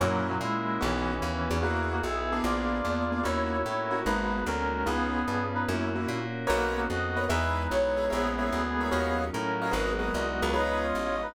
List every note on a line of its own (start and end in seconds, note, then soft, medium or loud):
0.00 0.39 F#2 medium
0.00 0.27 A#2 loud
0.00 0.27 F#3 loud
0.00 0.40 A#3 medium
0.00 0.34 A#3 medium
0.00 0.40 C#4 medium
0.00 0.34 C#4 medium
0.00 0.40 E4 medium
0.00 0.34 E4 medium
0.00 0.40 F#4 medium
0.00 0.34 F#4 medium
0.28 0.38 A#2 medium
0.28 0.38 F#3 medium
0.41 0.79 A#2 medium
0.41 0.81 G#3 medium
0.41 0.81 A#3 medium
0.41 0.81 C#4 medium
0.41 0.81 E4 medium
0.41 0.81 F#4 medium
0.41 0.81 A#4 medium
0.81 1.20 B1 medium
0.81 1.58 E3 medium
0.81 1.14 B3 medium
0.81 1.21 B3 medium
0.81 1.14 C#4 medium
0.81 1.21 C#4 medium
0.81 1.58 C#4 medium
0.81 1.14 D#4 medium
0.81 1.22 D#4 medium
0.81 1.14 F#4 medium
0.81 1.21 F#4 medium
1.22 1.49 D#2 medium
1.22 1.62 B3 medium
1.22 1.62 C#4 medium
1.22 1.62 F#4 medium
1.22 1.62 B4 medium
1.50 2.01 E2 medium
1.50 1.58 B3 medium
1.50 1.58 C#4 medium
1.50 1.58 D#4 medium
1.50 1.58 F#4 medium
1.62 1.88 A#3 medium
1.62 2.02 B3 medium
1.62 1.96 B3 medium
1.62 2.02 E4 medium
1.62 1.96 E4 medium
1.62 1.88 F#4 loud
1.62 2.03 F#4 medium
1.62 1.96 F#4 medium
1.62 2.02 G#4 medium
1.62 1.96 G#4 medium
1.91 2.02 A#3 medium
1.91 2.02 F#4 medium
2.03 2.41 B1 medium
2.03 2.43 B3 medium
2.03 2.43 E4 medium
2.03 2.39 G#4 medium
2.03 2.43 G#4 medium
2.03 2.43 B4 medium
2.03 2.39 E5 medium
2.32 2.78 A#3 medium
2.32 2.78 B3 medium
2.32 2.78 D4 medium
2.32 2.78 G#4 medium
2.43 2.82 A#1 medium
2.43 2.83 A#3 medium
2.43 2.83 B3 medium
2.43 2.83 D4 medium
2.43 3.22 F4 medium
2.43 2.83 G#4 medium
2.43 3.22 D5 medium
2.84 3.23 E2 medium
2.84 3.24 A#3 medium
2.84 3.04 A#3 medium
2.84 3.24 B3 medium
2.84 3.04 B3 medium
2.84 3.04 D4 medium
2.84 3.24 F4 medium
2.84 3.24 G#4 medium
2.84 3.04 G#4 medium
3.12 3.21 A#3 medium
3.12 3.21 B3 medium
3.12 3.21 D4 medium
3.12 3.21 G#4 medium
3.23 3.63 D#2 medium
3.23 3.57 A#3 medium
3.23 3.64 A#3 medium
3.23 3.57 C#4 medium
3.23 3.64 C#4 medium
3.23 3.57 D#4 medium
3.23 3.65 D#4 medium
3.23 4.01 E4 medium
3.23 3.57 F#4 medium
3.23 3.64 F#4 medium
3.23 4.01 C#5 loud
3.65 4.04 A2 medium
3.65 4.05 A#3 medium
3.65 4.05 C#4 medium
3.65 4.05 F#4 medium
3.65 4.05 A#4 medium
3.91 3.99 A#3 medium
3.91 3.99 C#4 medium
3.91 3.99 D#4 medium
3.91 3.99 F#4 medium
4.05 4.44 G#1 medium
4.05 4.45 G#3 medium
4.05 4.39 G#3 medium
4.05 4.45 A#3 medium
4.05 4.39 A#3 medium
4.05 4.46 B3 medium
4.05 4.39 B3 medium
4.05 4.44 D#4 medium
4.05 4.45 F#4 medium
4.05 4.39 F#4 medium
4.05 4.44 B4 loud
4.46 4.84 D2 medium
4.46 4.86 G#3 medium
4.46 4.86 A#3 medium
4.46 4.83 C#4 medium
4.46 4.86 D#4 medium
4.46 4.86 F#4 medium
4.46 4.83 A#4 medium
4.86 5.25 C#2 medium
4.86 5.19 B3 medium
4.86 5.27 B3 medium
4.86 5.43 B3 loud
4.86 5.19 C#4 medium
4.86 5.27 C#4 medium
4.86 5.19 D#4 medium
4.86 5.27 D#4 medium
4.86 5.19 F4 medium
4.86 5.27 F4 medium
4.86 5.43 G#4 loud
5.27 5.66 G2 medium
5.27 5.67 B3 medium
5.27 5.67 C#4 medium
5.27 5.67 F4 medium
5.27 5.67 G#4 medium
5.54 5.65 D#4 medium
5.54 5.65 B4 loud
5.68 6.07 F#2 medium
5.68 6.08 A#3 medium
5.68 5.89 A#3 medium
5.68 6.08 C#4 medium
5.68 5.89 C#4 medium
5.68 6.08 E4 medium
5.68 5.89 E4 medium
5.68 6.08 F#4 medium
5.68 5.89 F#4 medium
5.95 6.19 A#3 medium
5.95 6.19 C#4 medium
5.95 6.19 E4 medium
5.95 6.19 F#4 medium
6.08 6.46 A#2 medium
6.08 6.48 A#3 medium
6.08 6.48 C#4 medium
6.08 6.48 F#4 medium
6.08 6.48 A#4 medium
6.47 6.88 B1 medium
6.47 6.73 A#3 loud
6.47 6.89 A#3 medium
6.47 6.89 B3 medium
6.47 6.89 C#4 medium
6.47 6.89 D#4 medium
6.47 6.73 F#4 loud
6.47 6.80 A#4 medium
6.47 6.80 B4 medium
6.47 6.80 C#5 loud
6.47 6.80 D#5 medium
6.76 6.87 A#3 medium
6.76 6.87 F#4 loud
6.89 7.28 F2 medium
6.89 7.29 A#3 medium
6.89 7.29 B3 medium
6.89 7.29 D#4 medium
6.89 7.28 F#4 loud
6.89 7.29 F#4 medium
6.89 7.28 D#5 loud
7.16 7.25 A#4 medium
7.16 7.25 B4 medium
7.16 7.25 C#5 medium
7.16 7.25 D#5 medium
7.29 7.68 E2 loud
7.29 7.70 G#3 medium
7.29 7.70 B3 medium
7.29 8.04 D#4 medium
7.29 7.70 D#4 medium
7.29 7.70 E4 medium
7.29 7.62 G#4 medium
7.29 7.62 B4 medium
7.29 8.04 B4 medium
7.29 7.62 D#5 medium
7.29 7.62 E5 medium
7.70 8.09 B1 medium
7.70 8.10 G#3 medium
7.70 8.10 B3 medium
7.70 8.10 E4 medium
7.70 8.10 G#4 medium
7.70 8.10 C#5 medium
7.97 8.06 G#4 medium
7.97 8.06 B4 medium
7.97 8.06 D#5 medium
7.97 8.06 E5 medium
8.10 8.51 A#1 medium
8.10 8.51 G#3 medium
8.10 8.51 A#3 medium
8.10 9.22 B3 loud
8.10 8.51 C#4 medium
8.10 8.51 E4 medium
8.10 8.30 G#4 medium
8.10 9.22 G#4 loud
8.10 8.30 A#4 medium
8.10 8.30 C#5 medium
8.10 8.30 E5 medium
8.38 8.62 G#4 medium
8.38 8.62 A#4 medium
8.38 8.62 C#5 medium
8.38 8.62 E5 medium
8.51 8.90 D2 medium
8.51 8.91 G#3 medium
8.51 8.91 A#3 medium
8.51 8.91 E4 medium
8.51 8.91 G#4 medium
8.80 8.89 G#4 medium
8.80 8.89 A#4 medium
8.80 8.89 C#5 medium
8.80 8.89 E5 medium
8.91 9.30 D#2 medium
8.91 9.32 F#3 medium
8.91 9.32 C#4 medium
8.91 9.32 D#4 medium
8.91 9.32 F4 medium
8.91 9.24 F#4 medium
8.91 9.24 C#5 medium
8.91 9.24 D#5 medium
8.91 9.24 F5 medium
9.32 9.72 A2 medium
9.32 9.73 F#3 medium
9.32 9.73 C#4 medium
9.32 9.71 C#4 medium
9.32 9.73 F4 medium
9.32 9.73 F#4 medium
9.32 9.71 A#4 medium
9.62 9.70 F#4 medium
9.62 9.70 C#5 medium
9.62 9.70 D#5 medium
9.62 9.70 F5 medium
9.71 10.11 G#1 medium
9.71 10.13 F#3 medium
9.71 10.13 G#3 medium
9.71 10.14 A#3 medium
9.71 10.13 B3 medium
9.71 9.91 F#4 medium
9.71 10.49 F#4 medium
9.71 9.91 G#4 medium
9.71 9.91 A#4 medium
9.71 9.91 B4 medium
9.71 10.49 D#5 loud
9.99 10.22 F#4 medium
9.99 10.22 G#4 medium
9.99 10.22 A#4 medium
9.99 10.22 B4 medium
10.14 10.41 C2 medium
10.14 10.54 F#3 medium
10.14 10.54 G#3 medium
10.14 10.54 B3 medium
10.14 10.54 D#4 medium
10.42 10.93 C#2 medium
10.42 10.51 F#4 medium
10.42 10.51 G#4 medium
10.42 10.51 A#4 medium
10.42 10.51 B4 medium
10.53 10.94 F3 medium
10.53 10.94 G#3 medium
10.53 10.94 B3 medium
10.53 10.94 C#4 medium
10.53 10.77 D#4 loud
10.53 10.87 F4 medium
10.53 10.87 G#4 loud
10.53 10.77 B4 loud
10.53 10.87 B4 medium
10.53 10.87 C#5 medium
10.53 11.34 D#5 medium
10.83 11.16 F4 medium
10.83 11.16 C#5 loud
10.95 11.33 A1 medium
10.95 11.34 F3 medium
10.95 11.34 G#3 medium
10.95 11.34 C#4 medium
10.95 11.34 F4 medium
11.22 11.34 D#4 loud
11.22 11.34 B4 loud